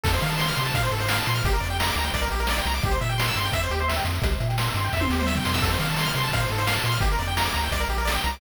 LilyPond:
<<
  \new Staff \with { instrumentName = "Lead 1 (square)" } { \time 4/4 \key f \major \tempo 4 = 172 a'16 c''16 f''16 a''16 c'''16 f'''16 c'''16 a''16 f''16 c''16 a'16 c''16 f''16 a''16 c'''16 f'''16 | g'16 bes'16 d''16 g''16 bes''16 d'''16 bes''16 g''16 d''16 bes'16 g'16 bes'16 d''16 g''16 bes''16 d'''16 | g'16 c''16 e''16 g''16 c'''16 e'''16 c'''16 g''16 e''16 c''16 g'16 c''16 e''16 g''16 c'''16 e'''16 | g'16 c''16 e''16 g''16 c'''16 e'''16 c'''16 g''16 e''16 c''16 g'16 c''16 e''16 g''16 c'''16 e'''16 |
a'16 c''16 f''16 a''16 c'''16 f'''16 c'''16 a''16 f''16 c''16 a'16 c''16 f''16 a''16 c'''16 f'''16 | g'16 bes'16 d''16 g''16 bes''16 d'''16 bes''16 g''16 d''16 bes'16 g'16 bes'16 d''16 g''16 bes''16 d'''16 | }
  \new Staff \with { instrumentName = "Synth Bass 1" } { \clef bass \time 4/4 \key f \major f,8 ees4 c8 bes,8 aes,4 bes,8 | g,,8 f,4 d,8 c,8 bes,,4 c,8 | c,8 bes,4 g,8 f,8 ees,4 f,8 | c,8 bes,4 g,8 f,8 ees,4 f,8 |
f,8 ees4 c8 bes,8 aes,4 bes,8 | g,,8 f,4 d,8 c,8 bes,,4 c,8 | }
  \new DrumStaff \with { instrumentName = "Drums" } \drummode { \time 4/4 <cymc bd>16 hh16 hh16 hh16 sn16 hh16 hh16 hh16 <hh bd>16 hh16 hh16 hh16 sn16 hh16 hh16 hh16 | <hh bd>16 hh16 hh16 hh16 sn16 hh16 hh16 hh16 <hh bd>16 hh16 hh16 hh16 sn16 hh16 hh16 hh16 | <hh bd>16 hh16 hh16 hh16 sn16 hh16 hh16 hh16 <hh bd>16 hh16 hh16 hh16 sn16 hh16 hh16 hh16 | <hh bd>16 hh16 hh16 hh16 sn16 hh16 hh16 hh16 <bd sn>16 tommh16 sn16 toml16 sn16 tomfh16 sn16 sn16 |
<cymc bd>16 hh16 hh16 hh16 sn16 hh16 hh16 hh16 <hh bd>16 hh16 hh16 hh16 sn16 hh16 hh16 hh16 | <hh bd>16 hh16 hh16 hh16 sn16 hh16 hh16 hh16 <hh bd>16 hh16 hh16 hh16 sn16 hh16 hh16 hh16 | }
>>